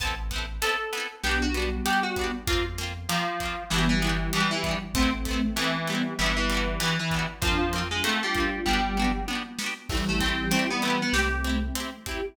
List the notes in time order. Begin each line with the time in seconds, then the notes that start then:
0.00 A1 B3 C4 A5, kick, closed hi-hat
0.05 E4 A4
0.31 B3 C4, kick, snare, closed hi-hat
0.36 E4 A4
0.62 B3 C4 A4, closed hi-hat
0.66 E4 A4
0.93 B3 C4, closed hi-hat
0.97 E4 A4
1.23 B1 B3 D4 G4, snare
1.29 F#4 G4
1.42 F#4
1.54 G3 B3 D4, closed hi-hat
1.59 F#4 G4
1.85 B3 D4 G4, closed hi-hat
1.90 F#4 G4
2.03 F#4
2.16 B3 D4, kick, closed hi-hat
2.21 F#4 G4
2.47 F2 A#3 C4 F4, kick, closed hi-hat
2.52 F4
2.78 A#3 C4, snare, closed hi-hat
2.83 F4
3.09 F3 A#3 C4, closed hi-hat
3.14 F4
3.40 A#3 C4, kick, closed hi-hat
3.45 F4
3.70 G1 E3 G3 B3 D4, snare
3.76 F#4 G4
3.89 E3
4.02 E3 G3 B3 D4, closed hi-hat
4.07 F#4 G4
4.33 E3 B3 D4, closed hi-hat
4.38 F#4 G4
4.51 E3
4.64 B3 D4, kick, closed hi-hat
4.69 F#4 G4
4.94 A1 A3 B3 C4, kick, closed hi-hat
5.00 C4 E4
5.25 A3 B3, kick, snare, closed hi-hat
5.31 C4 E4
5.56 E3 A3 B3, closed hi-hat
5.61 C4 E4
5.87 G3 A3 B3, closed hi-hat
5.92 C4 E4
6.19 G1 E3 G3 B3, snare
6.23 D4 F#4
6.37 E3
6.50 G3 B3, closed hi-hat
6.54 D4 F#4
6.80 E3 G3 B3, closed hi-hat
6.85 D4 F#4
6.99 E3
7.11 G3 B3, kick, closed hi-hat
7.16 D4 F#4
7.42 F2 F3 A#3 C4 D4 F4, kick, closed hi-hat
7.47 F4
7.73 A#3 C4, snare, closed hi-hat
7.78 F4
7.91 G#3 D4 F4
8.04 A3 A#3 C4, closed hi-hat
8.09 F4
8.23 G3 D4 F4
8.35 A#3 C4, kick, closed hi-hat
8.40 F4
8.66 G1 G3 B3 D4, kick
8.71 F#4 G4
8.97 B3 D4, mid tom
9.02 F#4 G4
9.28 B3 D4, high tom
9.33 F#4 G4
9.59 B3 D4, snare
9.64 F#4 G4
9.89 A1 E3 G3 A3 C4, kick, crash
9.94 E4 G4
10.09 A3
10.20 A3 C4, kick, snare, closed hi-hat
10.26 E4 G4
10.51 A3 C4, closed hi-hat
10.56 E4 G4
10.70 B3
10.82 A3 B3 C4, closed hi-hat
10.87 E4 G4
11.02 B3
11.13 C2 A3 C4 E4 G4, snare
11.18 G4
11.44 C4 E4, closed hi-hat
11.49 G4
11.75 C4 E4, closed hi-hat
11.80 G4
12.06 C4 E4 G4, kick, closed hi-hat
12.11 G4